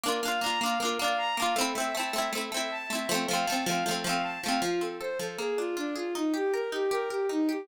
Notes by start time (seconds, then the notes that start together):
0.04 A#3 D4 A#4
0.08 F4
0.23 A#3 D4 F5
0.28 F4
0.41 A#3 D4 A#5
0.46 F4
0.61 A#3 D4 F5
0.66 F4
0.80 A#3 D4 A#4
0.85 F4
0.99 A#3 D4 F5
1.04 F4
1.18 A#5
1.37 A#3 D4 F5
1.42 F4
1.56 A3 C4 A4
1.61 E4
1.75 A3 C4 E5
1.80 E4
1.95 A3 C4 A5
2.00 E4
2.13 A3 C4 E5
2.18 E4
2.32 A3 C4 A4
2.38 E4
2.52 A3 C4 E5
2.57 E4
2.71 A5
2.90 A3 C4 E5
2.95 E4
3.09 F3 A3 A4
3.14 C4
3.27 F3 A3 F5
3.33 C4
3.46 F3 A3 A5
3.52 C4
3.66 F3 A3 F5
3.71 C4
3.86 F3 A3 A4
3.91 C4
4.04 F3 A3 F5
4.09 C4
4.23 A5
4.43 F3 A3 F5
4.48 C4
4.62 F3 F4
4.81 C4 A4
5.00 A4 C5
5.19 F3 A4
5.38 A#3 G#4
5.58 D4 F4
5.77 D4 F4
5.95 F4 G#4
6.15 D#4
6.34 G4
6.53 A#4
6.72 D#4 G4
6.91 G4 A#4
7.09 G4 A#4
7.29 D#4
7.49 G4